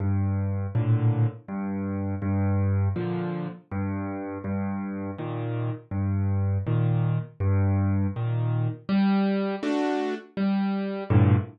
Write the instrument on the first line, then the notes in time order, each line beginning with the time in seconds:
acoustic grand piano
0.00 G2
0.75 A2 A#2 D3
1.48 G2
2.22 G2
2.96 A#2 D3 F3
3.72 G2
4.44 G2
5.18 A#2 D#3
5.91 G2
6.67 A#2 D#3
7.40 G2
8.16 A#2 D#3
8.89 G3
9.63 A3 D4 F#4
10.37 G3
11.10 G2 A2 A#2 D3